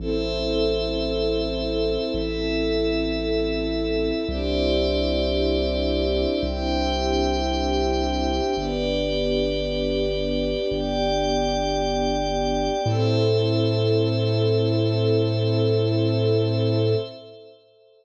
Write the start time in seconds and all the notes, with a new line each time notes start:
0.00 A1 C4 E4 A4 C5 E5
2.14 A1 E4 A4 E5
4.29 C2 C4 D4 E4 G4 C5 D5 E5
6.43 C2 G4 C5 E5 G5
8.56 G1 B3 D4 G4 B4 D5
10.71 G1 G4 D5 G5
12.85 A2 C4 E4 A4 C5 E5